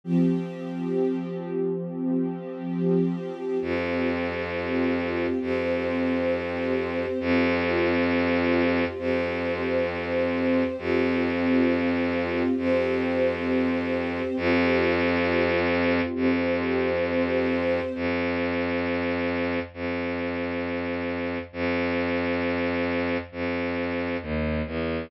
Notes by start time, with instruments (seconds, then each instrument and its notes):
0.04 string ensemble 1 F3 C4 G4
3.61 violin F2, string ensemble 1 C4 F4 G4
5.41 violin F2, string ensemble 1 C4 G4 C5
7.20 violin F2, string ensemble 1 C4 F4 G4
8.98 violin F2, string ensemble 1 C4 G4 C5
10.78 violin F2, string ensemble 1 C4 F4 G4
12.57 violin F2, string ensemble 1 C4 G4 C5
14.36 violin F2, string ensemble 1 C4 F4 G4
16.15 violin F2, string ensemble 1 C4 G4 C5
17.95 violin F2
19.74 violin F2
21.53 violin F2
23.32 violin F2
24.22 violin D#2
24.66 violin E2